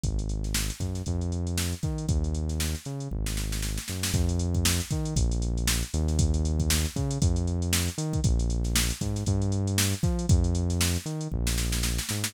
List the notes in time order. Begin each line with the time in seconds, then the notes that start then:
0.04 G#1, kick, closed hi-hat
0.19 closed hi-hat
0.29 closed hi-hat
0.44 snare, closed hi-hat
0.54 snare
0.70 snare, closed hi-hat
0.80 F#2, kick, snare, closed hi-hat
0.95 snare, closed hi-hat
1.06 F2, kick, closed hi-hat
1.21 closed hi-hat
1.32 closed hi-hat
1.47 closed hi-hat
1.58 snare
1.73 closed hi-hat
1.83 D#3, kick, snare, closed hi-hat
1.98 closed hi-hat
2.08 D#2, kick, closed hi-hat
2.24 closed hi-hat
2.35 closed hi-hat
2.49 snare, closed hi-hat
2.60 snare
2.75 snare, closed hi-hat
2.85 C#3, snare, closed hi-hat
3.00 closed hi-hat
3.11 G#1, kick
3.26 snare
3.37 snare
3.52 snare
3.62 snare
3.78 snare
3.88 F#2, snare
4.03 snare
4.14 F2, kick, closed hi-hat
4.29 closed hi-hat
4.39 closed hi-hat
4.54 kick, closed hi-hat
4.65 snare
4.80 snare, closed hi-hat
4.90 D#3, kick, snare, closed hi-hat
5.05 closed hi-hat
5.16 A#1, kick, closed hi-hat
5.32 closed hi-hat
5.42 closed hi-hat
5.57 closed hi-hat
5.68 snare
5.83 closed hi-hat
5.94 D#2, closed hi-hat
6.08 snare, closed hi-hat
6.19 kick, closed hi-hat
6.34 closed hi-hat
6.45 closed hi-hat
6.60 kick, closed hi-hat
6.70 snare
6.85 snare, closed hi-hat
6.96 C#3, kick, closed hi-hat
7.11 closed hi-hat
7.22 F2, kick, closed hi-hat
7.36 closed hi-hat
7.47 closed hi-hat
7.62 closed hi-hat
7.73 snare
7.88 closed hi-hat
7.98 D#3, closed hi-hat
8.13 kick, closed hi-hat
8.24 A#1, kick, closed hi-hat
8.39 closed hi-hat
8.50 closed hi-hat
8.64 snare, closed hi-hat
8.76 snare
8.90 snare, closed hi-hat
9.01 G#2, kick, snare, closed hi-hat
9.16 snare, closed hi-hat
9.26 G2, kick, closed hi-hat
9.42 closed hi-hat
9.52 closed hi-hat
9.67 closed hi-hat
9.78 snare
9.93 closed hi-hat
10.03 F3, kick, snare, closed hi-hat
10.19 closed hi-hat
10.29 F2, kick, closed hi-hat
10.44 closed hi-hat
10.55 closed hi-hat
10.70 snare, closed hi-hat
10.81 snare
10.95 snare, closed hi-hat
11.06 D#3, snare, closed hi-hat
11.21 closed hi-hat
11.32 A#1, kick
11.47 snare
11.58 snare
11.72 snare
11.83 snare
11.99 snare
12.09 G#2, snare
12.24 snare